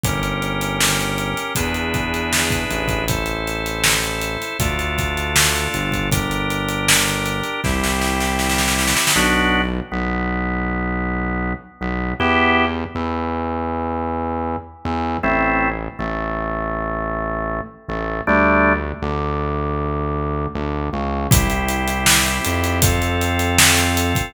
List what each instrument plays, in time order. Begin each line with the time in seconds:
0.03 synth bass 1 G1, drawbar organ C#4 G4 A#4, kick, closed hi-hat
0.23 closed hi-hat
0.42 closed hi-hat
0.61 closed hi-hat
0.81 snare
1.00 closed hi-hat
1.18 closed hi-hat
1.37 closed hi-hat
1.55 synth bass 1 E2, drawbar organ D4 E4 G#4 B4, kick, closed hi-hat
1.74 closed hi-hat
1.94 kick, closed hi-hat
2.14 closed hi-hat
2.33 snare
2.50 kick, closed hi-hat
2.70 synth bass 1 A1, closed hi-hat
2.88 kick, closed hi-hat
3.08 drawbar organ E4 A4 C5, kick, closed hi-hat
3.26 closed hi-hat
3.47 closed hi-hat
3.66 closed hi-hat
3.84 snare
4.03 closed hi-hat
4.21 closed hi-hat
4.42 closed hi-hat
4.59 synth bass 1 D2, drawbar organ D4 F4 A4, kick, closed hi-hat
4.79 closed hi-hat
4.98 kick, closed hi-hat
5.17 closed hi-hat
5.36 snare
5.56 closed hi-hat
5.74 synth bass 1 G1, closed hi-hat
5.92 kick, closed hi-hat
6.12 drawbar organ D4 G4 A#4, kick, closed hi-hat
6.31 closed hi-hat
6.50 closed hi-hat
6.69 closed hi-hat
6.88 snare
7.08 closed hi-hat
7.26 closed hi-hat
7.44 closed hi-hat
7.64 synth bass 1 C2, drawbar organ C4 E4 G4, kick, snare
7.84 snare
8.01 snare
8.20 snare
8.39 snare
8.50 snare
8.58 snare
8.68 snare
8.79 snare
8.88 snare
8.96 snare
9.07 snare
9.16 synth bass 1 B1, drawbar organ B3 D4 F#4
9.92 synth bass 1 B1, drawbar organ B3
11.81 synth bass 1 B1, drawbar organ B3
12.20 synth bass 1 E2, drawbar organ B3 E4 G4
12.95 synth bass 1 E2, drawbar organ E3
14.85 synth bass 1 E2, drawbar organ E3
15.23 synth bass 1 A1, drawbar organ A3 C4 E4
15.99 synth bass 1 A1, drawbar organ A3
17.88 synth bass 1 A1, drawbar organ A3
18.27 synth bass 1 D2, drawbar organ G3 A3 D4
19.02 synth bass 1 D2, drawbar organ D3
20.55 synth bass 1 D2, drawbar organ D3
20.93 synth bass 1 C#2, drawbar organ C#3
21.31 synth bass 1 C2, drawbar organ C4 E4 G4, kick, closed hi-hat
21.50 closed hi-hat
21.69 closed hi-hat
21.88 closed hi-hat
22.06 snare
22.26 closed hi-hat
22.44 synth bass 1 F2, closed hi-hat
22.64 closed hi-hat
22.82 drawbar organ C4 F4 A4, kick, closed hi-hat
23.02 closed hi-hat
23.21 closed hi-hat
23.39 closed hi-hat
23.58 snare
23.77 closed hi-hat
23.97 closed hi-hat
24.15 kick, closed hi-hat